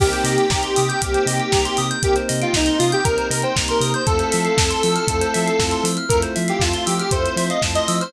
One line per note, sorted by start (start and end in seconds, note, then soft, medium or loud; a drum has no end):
0.00 0.13 C2 loud
0.00 0.45 A#3 loud
0.00 4.02 A#3 medium
0.00 0.45 C4 loud
0.00 4.02 C4 medium
0.00 0.45 D#4 loud
0.00 4.02 D#4 medium
0.00 0.45 G4 loud
0.00 1.86 G4 medium
0.00 4.02 G4 medium
0.00 0.11 A#4 loud
0.00 kick loud
0.00 crash loud
0.13 0.24 C5 medium
0.13 closed hi-hat medium
0.24 0.38 C3 medium
0.24 0.37 D#5 medium
0.24 open hi-hat medium
0.38 0.50 G5 medium
0.38 closed hi-hat medium
0.50 0.64 C2 medium
0.50 0.97 A#3 medium
0.50 0.97 C4 medium
0.50 0.97 D#4 medium
0.50 0.97 G4 medium
0.50 0.62 A#5 medium
0.50 kick medium
0.50 snare loud
0.63 0.75 C6 medium
0.63 closed hi-hat medium
0.76 0.91 C3 loud
0.76 0.88 D#6 medium
0.76 open hi-hat medium
0.89 1.00 G6 medium
0.89 closed hi-hat medium
1.02 1.16 C2 loud
1.02 1.49 A#3 loud
1.02 1.49 C4 medium
1.02 1.49 D#4 medium
1.02 1.49 G4 medium
1.02 1.13 A#4 medium
1.02 kick medium
1.02 closed hi-hat loud
1.14 1.26 C5 medium
1.14 closed hi-hat medium
1.26 1.40 C3 loud
1.26 1.39 D#5 medium
1.26 open hi-hat medium
1.40 1.51 G5 medium
1.40 closed hi-hat medium
1.52 1.67 C2 loud
1.52 1.98 A#3 medium
1.52 1.98 C4 medium
1.52 1.98 D#4 medium
1.52 1.98 G4 medium
1.52 1.64 A#5 loud
1.52 kick medium
1.52 snare loud
1.65 1.77 C6 medium
1.65 closed hi-hat medium
1.77 1.92 C3 medium
1.77 1.89 D#6 loud
1.77 open hi-hat medium
1.91 2.02 G6 medium
1.91 closed hi-hat medium
2.02 2.16 C2 medium
2.02 2.49 A#3 loud
2.02 2.49 C4 loud
2.02 2.49 D#4 medium
2.02 2.15 G4 medium
2.02 2.49 G4 medium
2.02 2.15 A#4 medium
2.02 kick medium
2.02 closed hi-hat loud
2.16 2.28 C5 medium
2.16 closed hi-hat medium
2.29 2.44 C3 medium
2.29 2.40 D#5 medium
2.29 open hi-hat medium
2.42 2.54 F4 medium
2.42 2.53 G5 medium
2.42 closed hi-hat medium
2.53 2.69 C2 loud
2.53 3.00 A#3 medium
2.53 3.00 C4 medium
2.53 3.00 D#4 medium
2.53 2.79 D#4 medium
2.53 3.00 G4 medium
2.53 2.66 A#5 loud
2.53 kick medium
2.53 snare loud
2.66 2.78 C6 medium
2.66 closed hi-hat medium
2.79 2.94 C3 medium
2.79 2.91 F4 medium
2.79 2.91 D#6 medium
2.79 open hi-hat medium
2.92 3.05 G4 medium
2.92 3.04 G6 loud
2.92 closed hi-hat medium
3.04 3.19 C2 loud
3.04 3.52 A#3 medium
3.04 3.52 C4 medium
3.04 3.52 D#4 medium
3.04 3.52 G4 medium
3.04 3.27 A#4 medium
3.04 3.17 A#4 medium
3.04 kick medium
3.04 closed hi-hat medium
3.18 3.29 C5 medium
3.18 closed hi-hat medium
3.30 3.44 C3 medium
3.30 3.42 A#4 medium
3.30 3.42 D#5 medium
3.30 open hi-hat medium
3.42 3.55 C5 medium
3.42 3.55 G5 medium
3.42 closed hi-hat medium
3.56 3.71 C2 loud
3.56 4.02 A#3 medium
3.56 4.02 C4 medium
3.56 4.02 D#4 medium
3.56 4.02 G4 loud
3.56 3.67 A#5 medium
3.56 kick medium
3.56 snare loud
3.68 3.92 A#4 medium
3.68 3.80 C6 medium
3.68 closed hi-hat medium
3.80 3.94 C3 loud
3.80 3.93 D#6 medium
3.80 open hi-hat medium
3.94 4.07 C5 medium
3.94 4.06 G6 medium
3.94 closed hi-hat medium
4.06 4.22 F2 loud
4.06 8.09 A3 medium
4.06 4.53 A3 loud
4.06 8.09 C4 medium
4.06 4.53 C4 loud
4.06 8.09 E4 medium
4.06 4.53 E4 loud
4.06 8.09 F4 medium
4.06 4.53 F4 loud
4.06 5.85 A4 medium
4.06 4.18 A4 loud
4.06 kick medium
4.06 closed hi-hat medium
4.19 4.31 C5 medium
4.19 closed hi-hat medium
4.32 4.48 F3 medium
4.32 4.44 E5 medium
4.32 open hi-hat medium
4.45 4.56 F5 medium
4.45 closed hi-hat medium
4.57 4.71 F2 medium
4.57 5.04 A3 medium
4.57 5.04 C4 medium
4.57 5.04 E4 medium
4.57 5.04 F4 medium
4.57 4.69 A5 medium
4.57 kick medium
4.57 snare loud
4.70 4.82 C6 medium
4.70 closed hi-hat medium
4.83 4.98 F3 medium
4.83 4.94 E6 medium
4.83 open hi-hat medium
4.96 5.07 F6 medium
4.96 closed hi-hat medium
5.08 5.22 F2 loud
5.08 5.55 A3 medium
5.08 5.55 C4 loud
5.08 5.55 E4 medium
5.08 5.55 F4 medium
5.08 5.20 A4 medium
5.08 kick medium
5.08 closed hi-hat loud
5.21 5.33 C5 medium
5.21 closed hi-hat medium
5.34 5.50 F3 medium
5.34 5.45 E5 medium
5.34 open hi-hat medium
5.47 5.58 F5 medium
5.47 closed hi-hat medium
5.59 5.73 F2 medium
5.59 6.05 A3 loud
5.59 6.05 C4 loud
5.59 6.05 E4 medium
5.59 6.05 F4 loud
5.59 5.71 A5 medium
5.59 kick medium
5.59 snare medium
5.71 5.83 C6 medium
5.71 closed hi-hat medium
5.84 5.98 F3 medium
5.84 5.96 E6 medium
5.84 open hi-hat medium
5.97 6.09 F6 medium
5.97 closed hi-hat medium
6.09 6.24 F2 loud
6.09 6.57 A3 loud
6.09 6.57 C4 medium
6.09 6.57 E4 medium
6.09 6.57 F4 medium
6.09 6.22 A4 medium
6.09 6.21 A#4 medium
6.09 kick medium
6.09 closed hi-hat loud
6.22 6.34 C5 medium
6.22 closed hi-hat medium
6.36 6.51 F3 loud
6.36 6.47 E5 medium
6.36 open hi-hat medium
6.48 6.61 G4 medium
6.48 6.60 F5 medium
6.48 closed hi-hat medium
6.59 6.73 F2 loud
6.59 7.07 A3 medium
6.59 7.07 C4 medium
6.59 7.07 E4 loud
6.59 6.84 F4 medium
6.59 7.07 F4 medium
6.59 6.72 A5 medium
6.59 kick medium
6.59 snare loud
6.74 6.85 C6 medium
6.74 closed hi-hat medium
6.86 7.01 F3 medium
6.86 6.98 G4 medium
6.86 6.98 E6 medium
6.86 open hi-hat medium
6.99 7.13 G4 medium
6.99 7.11 F6 medium
6.99 closed hi-hat medium
7.11 7.27 F2 medium
7.11 7.58 A3 medium
7.11 7.58 C4 medium
7.11 7.58 E4 loud
7.11 7.58 F4 medium
7.11 7.23 A4 medium
7.11 7.36 C5 medium
7.11 kick medium
7.11 closed hi-hat loud
7.25 7.36 C5 medium
7.25 closed hi-hat medium
7.36 7.50 F3 medium
7.36 7.49 C5 medium
7.36 7.49 E5 medium
7.36 open hi-hat medium
7.50 7.62 D#5 medium
7.50 7.61 F5 medium
7.50 closed hi-hat medium
7.62 7.77 F2 loud
7.62 8.08 A3 medium
7.62 8.08 C4 medium
7.62 8.08 E4 medium
7.62 8.08 F4 medium
7.62 7.74 A5 medium
7.62 kick medium
7.62 snare loud
7.75 7.96 D#5 medium
7.75 7.87 C6 medium
7.75 closed hi-hat medium
7.88 8.02 F3 loud
7.88 8.00 E6 medium
7.88 open hi-hat medium
8.01 8.13 C5 medium
8.01 8.12 F6 medium
8.01 closed hi-hat medium